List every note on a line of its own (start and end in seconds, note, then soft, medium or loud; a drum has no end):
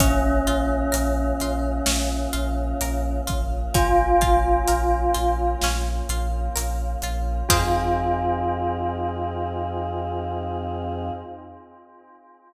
0.00 0.40 A#1 loud
0.00 7.42 A#3 medium
0.00 3.17 C#4 loud
0.00 7.42 C#4 medium
0.00 0.42 C#4 medium
0.00 7.42 F4 medium
0.00 kick loud
0.00 closed hi-hat loud
0.47 0.87 A#1 medium
0.47 0.89 F4 medium
0.47 closed hi-hat medium
0.92 1.33 A#1 loud
0.92 1.34 A#4 medium
0.92 closed hi-hat loud
1.40 1.81 A#1 medium
1.40 1.84 F4 medium
1.40 closed hi-hat medium
1.86 2.27 A#1 medium
1.86 2.29 C#4 medium
1.86 snare loud
2.33 2.74 A#1 medium
2.33 2.75 F4 medium
2.33 closed hi-hat medium
2.81 3.21 A#1 medium
2.81 3.24 A#4 medium
2.81 closed hi-hat loud
3.27 3.68 A#1 medium
3.27 3.69 F4 medium
3.27 kick loud
3.27 closed hi-hat medium
3.74 4.14 A#1 medium
3.74 4.17 C#4 medium
3.74 5.39 F4 loud
3.74 kick loud
3.74 closed hi-hat loud
4.21 4.62 A#1 medium
4.21 4.64 F4 medium
4.21 kick loud
4.21 closed hi-hat medium
4.68 5.09 A#1 medium
4.68 5.10 A#4 medium
4.68 closed hi-hat loud
5.14 5.56 A#1 medium
5.14 5.57 F4 medium
5.14 closed hi-hat medium
5.62 6.02 A#1 loud
5.62 6.06 C#4 medium
5.62 snare loud
6.09 6.49 A#1 loud
6.09 6.52 F4 medium
6.09 closed hi-hat medium
6.56 6.96 A#1 medium
6.56 6.98 A#4 medium
6.56 closed hi-hat loud
7.02 7.43 A#1 loud
7.02 7.46 F4 medium
7.02 closed hi-hat medium
7.49 11.11 F2 loud
7.49 11.11 C4 loud
7.49 11.11 D#4 loud
7.49 11.10 F4 loud
7.49 11.11 F4 loud
7.49 11.11 G#4 loud
7.49 kick loud
7.49 crash loud